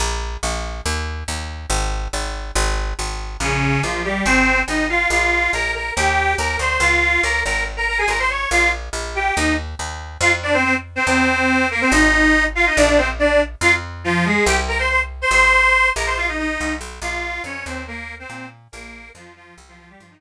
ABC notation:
X:1
M:2/4
L:1/16
Q:1/4=141
K:Bbdor
V:1 name="Accordion"
z8 | z8 | z8 | z8 |
[D,D]4 [F,F]2 [G,G]2 | [Cc]4 [Ee]2 [Ff]2 | [Ff]4 [Bb]2 [Bb]2 | [Gg]4 [Bb]2 [cc']2 |
[Ff]4 [Bb]2 [Bb]2 | z [Bb] [Bb] [Aa] [Bb] [cc'] [dd']2 | [Ff]2 z4 [Gg]2 | [Ee]2 z6 |
[K:Fdor] [Ff] z [Dd] [Cc] [Cc] z2 [Cc] | [Cc]6 [B,B] [Cc] | [Ee]6 [Ff] [Ee] | [Dd] [Dd] [Cc] z [Dd]2 z2 |
[Ff] z3 [F,F]2 [A,A]2 | [Gg] z [Bb] [cc'] [cc'] z2 [cc'] | [cc']6 [Bb] [cc'] | [Ff] [Ee] [Ee]4 z2 |
[K:Bbdor] [Ff]4 [Dd]2 [Cc]2 | [B,B]3 [Cc]3 z2 | [B,B]4 [F,F]2 [F,F]2 | z [F,F] [F,F] [G,G] [F,F] [E,E] z2 |]
V:2 name="Electric Bass (finger)" clef=bass
B,,,4 B,,,4 | E,,4 E,,4 | A,,,4 A,,,4 | A,,,4 A,,,4 |
B,,,4 B,,,4 | A,,,4 A,,,4 | B,,,4 B,,,4 | E,,4 E,,2 =D,,2 |
D,,4 D,,2 A,,,2- | A,,,4 A,,,4 | B,,,4 B,,,4 | E,,4 E,,4 |
[K:Fdor] F,,8 | =E,,8 | A,,,8 | B,,,8 |
F,,8 | C,,8 | A,,,6 B,,,2- | B,,,4 C,,2 =B,,,2 |
[K:Bbdor] B,,,4 F,,2 E,,2- | E,,4 B,,4 | B,,,4 F,,4 | C,,4 G,,4 |]